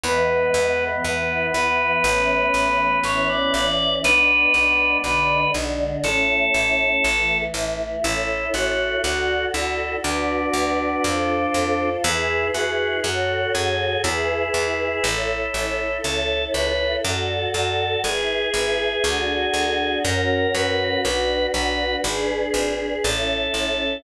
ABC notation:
X:1
M:4/4
L:1/16
Q:1/4=60
K:A
V:1 name="Drawbar Organ"
B4 B2 B6 c d d2 | B4 B2 z2 A6 z2 | z16 | z16 |
z16 | z16 |]
V:2 name="Drawbar Organ"
B,16 | D6 z10 | E2 F2 F2 E2 D8 | E2 F2 F2 G2 E8 |
A2 B2 A2 A2 G8 | ^A2 B2 B2 B2 z4 =A4 |]
V:3 name="Choir Aahs"
[E,G,B,]4 [E,B,E]4 [E,A,C]4 [E,CE]4 | [G,B,D]4 [D,G,D]4 [A,CE]4 [E,A,E]4 | [EAc]4 [FAd]4 [FBd]4 [=FA=c]4 | [EGB]4 [FAc]4 [EGB]4 [EAc]4 |
[EAc]4 [FAd]4 [EGB]4 [DFA]4 | [CF^A]4 [DFB]4 [DGB]4 [CE=A]4 |]
V:4 name="Electric Bass (finger)" clef=bass
E,,2 E,,2 E,,2 E,,2 A,,,2 A,,,2 A,,,2 A,,,2 | B,,,2 B,,,2 B,,,2 B,,,2 A,,,2 A,,,2 A,,,2 A,,,2 | A,,,2 A,,,2 D,,2 D,,2 D,,2 D,,2 =F,,2 F,,2 | E,,2 E,,2 F,,2 F,,2 E,,2 E,,2 A,,,2 A,,,2 |
C,,2 C,,2 F,,2 F,,2 G,,,2 G,,,2 D,,2 D,,2 | F,,2 F,,2 B,,,2 B,,,2 G,,,2 G,,,2 A,,,2 A,,,2 |]